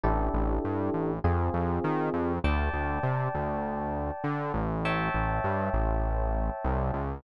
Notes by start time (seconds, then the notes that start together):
0.04 A1 D4 E4 G4 A4
0.34 A1
0.65 G2
0.94 A1
1.24 F2 C4 F4 G#4
1.54 F2
1.84 D#3
2.14 F2
2.44 D2 D5 G5 A5
2.73 D2
3.03 C3
3.34 D2
4.24 D3
4.54 A1
4.85 C#5 E5 G5 A5
5.14 A1
5.44 G2
5.73 A1
6.64 C2
6.93 C#2